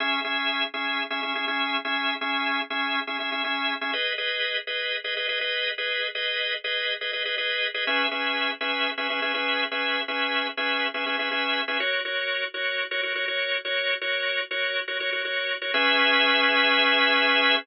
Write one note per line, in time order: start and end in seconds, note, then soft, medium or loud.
0.00 0.20 C#4 medium
0.00 0.20 G#4 medium
0.00 0.20 E5 medium
0.24 0.64 C#4 medium
0.24 0.64 G#4 medium
0.24 0.64 E5 medium
0.74 1.03 C#4 medium
0.74 1.03 G#4 medium
0.74 1.03 E5 medium
1.10 1.20 C#4 medium
1.10 1.20 G#4 medium
1.10 1.20 E5 medium
1.23 1.33 C#4 medium
1.23 1.33 G#4 medium
1.23 1.33 E5 medium
1.35 1.45 C#4 medium
1.35 1.45 G#4 medium
1.35 1.45 E5 medium
1.48 1.77 C#4 medium
1.48 1.77 G#4 medium
1.48 1.77 E5 medium
1.85 2.14 C#4 medium
1.85 2.14 G#4 medium
1.85 2.14 E5 medium
2.21 2.60 C#4 medium
2.21 2.60 G#4 medium
2.21 2.60 E5 medium
2.70 3.00 C#4 medium
2.70 3.00 G#4 medium
2.70 3.00 E5 medium
3.07 3.17 C#4 medium
3.07 3.17 G#4 medium
3.07 3.17 E5 medium
3.20 3.30 C#4 medium
3.20 3.30 G#4 medium
3.20 3.30 E5 medium
3.32 3.42 C#4 medium
3.32 3.42 G#4 medium
3.32 3.42 E5 medium
3.44 3.74 C#4 medium
3.44 3.74 G#4 medium
3.44 3.74 E5 medium
3.81 3.91 C#4 medium
3.81 3.91 G#4 medium
3.81 3.91 E5 medium
3.93 4.13 G#4 medium
3.93 4.13 B4 medium
3.93 4.13 D#5 medium
4.18 4.57 G#4 medium
4.18 4.57 B4 medium
4.18 4.57 D#5 medium
4.67 4.97 G#4 medium
4.67 4.97 B4 medium
4.67 4.97 D#5 medium
5.04 5.14 G#4 medium
5.04 5.14 B4 medium
5.04 5.14 D#5 medium
5.17 5.26 G#4 medium
5.17 5.26 B4 medium
5.17 5.26 D#5 medium
5.29 5.39 G#4 medium
5.29 5.39 B4 medium
5.29 5.39 D#5 medium
5.41 5.70 G#4 medium
5.41 5.70 B4 medium
5.41 5.70 D#5 medium
5.78 6.07 G#4 medium
5.78 6.07 B4 medium
5.78 6.07 D#5 medium
6.15 6.54 G#4 medium
6.15 6.54 B4 medium
6.15 6.54 D#5 medium
6.64 6.94 G#4 medium
6.64 6.94 B4 medium
6.64 6.94 D#5 medium
7.01 7.11 G#4 medium
7.01 7.11 B4 medium
7.01 7.11 D#5 medium
7.13 7.23 G#4 medium
7.13 7.23 B4 medium
7.13 7.23 D#5 medium
7.25 7.35 G#4 medium
7.25 7.35 B4 medium
7.25 7.35 D#5 medium
7.38 7.67 G#4 medium
7.38 7.67 B4 medium
7.38 7.67 D#5 medium
7.74 7.84 G#4 medium
7.74 7.84 B4 medium
7.74 7.84 D#5 medium
7.87 8.07 C#4 medium
7.87 8.07 G#4 medium
7.87 8.07 B4 medium
7.87 8.07 E5 medium
8.11 8.51 C#4 medium
8.11 8.51 G#4 medium
8.11 8.51 B4 medium
8.11 8.51 E5 medium
8.61 8.90 C#4 medium
8.61 8.90 G#4 medium
8.61 8.90 B4 medium
8.61 8.90 E5 medium
8.98 9.07 C#4 medium
8.98 9.07 G#4 medium
8.98 9.07 B4 medium
8.98 9.07 E5 medium
9.10 9.20 C#4 medium
9.10 9.20 G#4 medium
9.10 9.20 B4 medium
9.10 9.20 E5 medium
9.22 9.32 C#4 medium
9.22 9.32 G#4 medium
9.22 9.32 B4 medium
9.22 9.32 E5 medium
9.34 9.64 C#4 medium
9.34 9.64 G#4 medium
9.34 9.64 B4 medium
9.34 9.64 E5 medium
9.71 10.01 C#4 medium
9.71 10.01 G#4 medium
9.71 10.01 B4 medium
9.71 10.01 E5 medium
10.08 10.47 C#4 medium
10.08 10.47 G#4 medium
10.08 10.47 B4 medium
10.08 10.47 E5 medium
10.57 10.87 C#4 medium
10.57 10.87 G#4 medium
10.57 10.87 B4 medium
10.57 10.87 E5 medium
10.94 11.04 C#4 medium
10.94 11.04 G#4 medium
10.94 11.04 B4 medium
10.94 11.04 E5 medium
11.06 11.16 C#4 medium
11.06 11.16 G#4 medium
11.06 11.16 B4 medium
11.06 11.16 E5 medium
11.19 11.29 C#4 medium
11.19 11.29 G#4 medium
11.19 11.29 B4 medium
11.19 11.29 E5 medium
11.31 11.61 C#4 medium
11.31 11.61 G#4 medium
11.31 11.61 B4 medium
11.31 11.61 E5 medium
11.68 11.78 C#4 medium
11.68 11.78 G#4 medium
11.68 11.78 B4 medium
11.68 11.78 E5 medium
11.80 12.00 F#4 medium
11.80 12.00 A#4 medium
11.80 12.00 C#5 medium
12.05 12.44 F#4 medium
12.05 12.44 A#4 medium
12.05 12.44 C#5 medium
12.54 12.84 F#4 medium
12.54 12.84 A#4 medium
12.54 12.84 C#5 medium
12.91 13.01 F#4 medium
12.91 13.01 A#4 medium
12.91 13.01 C#5 medium
13.03 13.13 F#4 medium
13.03 13.13 A#4 medium
13.03 13.13 C#5 medium
13.15 13.25 F#4 medium
13.15 13.25 A#4 medium
13.15 13.25 C#5 medium
13.28 13.57 F#4 medium
13.28 13.57 A#4 medium
13.28 13.57 C#5 medium
13.65 13.94 F#4 medium
13.65 13.94 A#4 medium
13.65 13.94 C#5 medium
14.01 14.41 F#4 medium
14.01 14.41 A#4 medium
14.01 14.41 C#5 medium
14.51 14.80 F#4 medium
14.51 14.80 A#4 medium
14.51 14.80 C#5 medium
14.88 14.98 F#4 medium
14.88 14.98 A#4 medium
14.88 14.98 C#5 medium
15.00 15.10 F#4 medium
15.00 15.10 A#4 medium
15.00 15.10 C#5 medium
15.12 15.22 F#4 medium
15.12 15.22 A#4 medium
15.12 15.22 C#5 medium
15.25 15.54 F#4 medium
15.25 15.54 A#4 medium
15.25 15.54 C#5 medium
15.62 15.71 F#4 medium
15.62 15.71 A#4 medium
15.62 15.71 C#5 medium
15.74 17.55 C#4 loud
15.74 17.55 G#4 loud
15.74 17.55 B4 loud
15.74 17.55 E5 loud